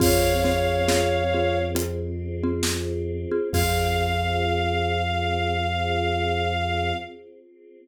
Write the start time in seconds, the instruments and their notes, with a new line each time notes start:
0.00 synth bass 2 F2, marimba C4 F4 G#4, choir aahs C4 F4 G#4, violin C#5 F5, kick, crash
0.44 marimba C4 F4 G#4, snare
0.88 marimba C4 F4 G#4, snare
1.34 marimba C4 F4 G#4
1.75 marimba C4 F4 G#4, closed hi-hat
2.43 marimba C4 F4 G#4
2.63 snare
3.31 marimba C4 F4 G#4
3.53 synth bass 2 F2, choir aahs C4 F4 G#4, marimba C4 F4 G#4, violin F5, kick, crash